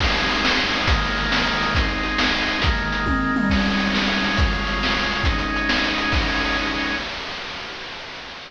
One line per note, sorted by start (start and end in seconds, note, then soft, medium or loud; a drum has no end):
0.00 0.86 G#3 medium
0.00 0.87 C4 medium
0.00 0.87 D#4 medium
0.00 kick loud
0.00 crash loud
0.16 closed hi-hat medium
0.30 closed hi-hat medium
0.45 snare loud
0.58 closed hi-hat medium
0.73 closed hi-hat medium
0.87 1.74 D#3 medium
0.87 1.74 G#3 loud
0.87 1.74 A#3 loud
0.87 kick loud
0.87 closed hi-hat loud
1.02 closed hi-hat medium
1.17 closed hi-hat medium
1.32 snare loud
1.44 closed hi-hat medium
1.62 closed hi-hat medium
1.75 2.62 G#3 medium
1.75 2.62 C4 medium
1.75 2.62 D#4 loud
1.75 kick loud
1.75 closed hi-hat loud
1.89 closed hi-hat medium
2.04 closed hi-hat medium
2.18 snare loud
2.34 closed hi-hat medium
2.48 closed hi-hat medium
2.62 3.49 D#3 loud
2.62 3.49 G#3 loud
2.62 3.49 A#3 medium
2.62 kick loud
2.62 closed hi-hat loud
2.77 closed hi-hat medium
2.92 closed hi-hat medium
3.06 kick medium
3.06 high tom medium
3.36 mid tom loud
3.50 4.37 G#3 loud
3.50 4.37 C#4 loud
3.50 4.37 D#4 medium
3.50 kick loud
3.50 crash loud
3.65 closed hi-hat medium
3.79 closed hi-hat medium
3.94 snare loud
4.08 closed hi-hat medium
4.24 closed hi-hat medium
4.37 5.24 C#3 medium
4.37 5.24 G#3 loud
4.37 5.24 F4 loud
4.37 kick loud
4.37 closed hi-hat loud
4.51 closed hi-hat medium
4.67 closed hi-hat medium
4.83 snare loud
4.97 closed hi-hat medium
5.11 closed hi-hat medium
5.24 6.13 G#3 loud
5.24 6.13 C#4 loud
5.24 6.13 D#4 loud
5.24 kick loud
5.24 closed hi-hat loud
5.39 closed hi-hat medium
5.56 closed hi-hat medium
5.69 snare loud
5.84 closed hi-hat medium
5.98 closed hi-hat medium
6.12 6.96 G#3 medium
6.12 6.96 C#4 loud
6.12 6.96 D#4 loud
6.12 kick loud
6.12 crash loud